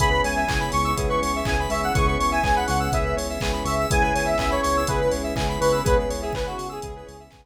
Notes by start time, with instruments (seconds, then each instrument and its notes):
0.00 synth bass 1 C#2, electric piano 1 B3 C#4 E4 G#4, pad 5 (bowed) B3 C#4 E4 G#4, lead 1 (square) G#4 B5, kick, closed hi-hat
0.11 lead 1 (square) B4
0.24 synth bass 1 C#2, lead 1 (square) C#5 G#5, open hi-hat
0.36 lead 1 (square) E5
0.48 synth bass 1 C#2, electric piano 1 B3 C#4 E4 G#4, lead 1 (square) G#5, kick, clap
0.60 lead 1 (square) B5
0.72 synth bass 1 C#2, lead 1 (square) C#6, snare, open hi-hat
0.84 lead 1 (square) E6
0.97 synth bass 1 C#2, electric piano 1 B3 C#4 E4 G#4, lead 1 (square) G#4, kick, closed hi-hat
1.09 lead 1 (square) B4 C#6
1.22 synth bass 1 C#2, lead 1 (square) C#5, open hi-hat
1.36 lead 1 (square) E5
1.45 synth bass 1 C#2, electric piano 1 B3 C#4 E4 G#4, lead 1 (square) G#5, kick, clap
1.60 lead 1 (square) B5
1.70 synth bass 1 C#2, lead 1 (square) E5 C#6, open hi-hat
1.82 lead 1 (square) F#5 E6
1.94 synth bass 1 C#2, electric piano 1 B3 C#4 E4 G#4, pad 5 (bowed) B3 C#4 E4 G#4, lead 1 (square) G#4 C#6, kick, closed hi-hat
2.06 lead 1 (square) B4 C#6
2.19 synth bass 1 C#2, lead 1 (square) C#5 C#6, open hi-hat
2.31 lead 1 (square) E5 G#5
2.43 synth bass 1 C#2, electric piano 1 B3 C#4 E4 G#4, lead 1 (square) G#5, kick, clap
2.56 lead 1 (square) F#5 B5
2.67 synth bass 1 C#2, lead 1 (square) F#5 C#6, snare, open hi-hat
2.80 lead 1 (square) E6
2.92 synth bass 1 C#2, electric piano 1 B3 C#4 E4 G#4, lead 1 (square) G#4 E5, kick, closed hi-hat
3.04 lead 1 (square) B4
3.16 synth bass 1 C#2, lead 1 (square) C#5, open hi-hat
3.30 lead 1 (square) E5
3.41 synth bass 1 C#2, electric piano 1 B3 C#4 E4 G#4, lead 1 (square) G#5, kick, clap
3.53 lead 1 (square) B5
3.65 synth bass 1 C#2, lead 1 (square) E5 C#6, open hi-hat
3.79 lead 1 (square) E6
3.90 synth bass 1 C#2, pad 5 (bowed) B3 C#4 E4 G#4, electric piano 1 B3 C#4 E4 G#4, lead 1 (square) G#4 G#5, kick, closed hi-hat
4.02 lead 1 (square) B4 G#5
4.14 synth bass 1 C#2, lead 1 (square) C#5 G#5, open hi-hat
4.25 lead 1 (square) E5
4.38 synth bass 1 C#2, electric piano 1 B3 C#4 E4 G#4, lead 1 (square) E5 G#5, kick, clap
4.50 lead 1 (square) C#5 B5
4.62 synth bass 1 C#2, lead 1 (square) C#5 C#6, snare, open hi-hat
4.77 lead 1 (square) E6
4.87 synth bass 1 C#2, electric piano 1 B3 C#4 E4 G#4, lead 1 (square) G#4 B4, kick, closed hi-hat
5.01 lead 1 (square) B4
5.11 synth bass 1 C#2, lead 1 (square) C#5, open hi-hat
5.24 lead 1 (square) E5
5.35 synth bass 1 C#2, electric piano 1 B3 C#4 E4 G#4, lead 1 (square) G#5, kick, clap
5.49 lead 1 (square) B5
5.60 synth bass 1 C#2, lead 1 (square) B4 C#6, open hi-hat
5.72 lead 1 (square) E6
5.84 synth bass 1 C#2, pad 5 (bowed) B3 C#4 E4 G#4, electric piano 1 B3 C#4 E4 G#4, lead 1 (square) G#4 B4, kick, closed hi-hat
5.98 lead 1 (square) B4
6.10 synth bass 1 C#2, lead 1 (square) C#5, open hi-hat
6.22 lead 1 (square) G#4 E5
6.33 synth bass 1 C#2, electric piano 1 B3 C#4 E4 G#4, lead 1 (square) B4 G#5, kick, clap
6.46 lead 1 (square) F#4 B5
6.57 synth bass 1 C#2, lead 1 (square) C#6, snare, open hi-hat
6.69 lead 1 (square) G#4 E6
6.82 synth bass 1 C#2, electric piano 1 B3 C#4 E4 G#4, lead 1 (square) G#4, kick, closed hi-hat
6.96 lead 1 (square) B4
7.06 synth bass 1 C#2, lead 1 (square) C#5, open hi-hat
7.20 lead 1 (square) E5
7.31 synth bass 1 C#2, electric piano 1 B3 C#4 E4 G#4, lead 1 (square) G#5, kick, clap
7.44 lead 1 (square) B5